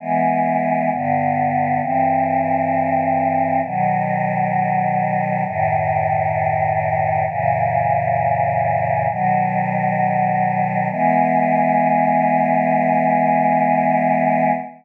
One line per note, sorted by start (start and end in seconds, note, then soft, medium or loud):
0.00 0.90 E3 medium
0.00 0.90 G#3 medium
0.00 0.90 B3 medium
0.91 1.80 G2 medium
0.91 1.81 D3 medium
0.91 1.81 B3 medium
1.81 3.61 G2 medium
1.81 3.61 E3 medium
1.81 3.61 C4 medium
3.64 5.44 B2 medium
3.64 5.44 D#3 medium
3.64 5.44 F#3 medium
5.45 7.25 F#2 medium
5.45 7.25 A2 medium
5.45 7.25 D#3 medium
7.27 9.07 F#2 medium
7.27 9.07 A#2 medium
7.27 9.07 C#3 medium
7.27 9.07 E3 medium
9.09 10.89 B2 medium
9.09 10.89 D#3 medium
9.09 10.89 F#3 medium
10.91 14.52 E3 loud
10.91 14.52 G#3 loud
10.91 14.52 B3 loud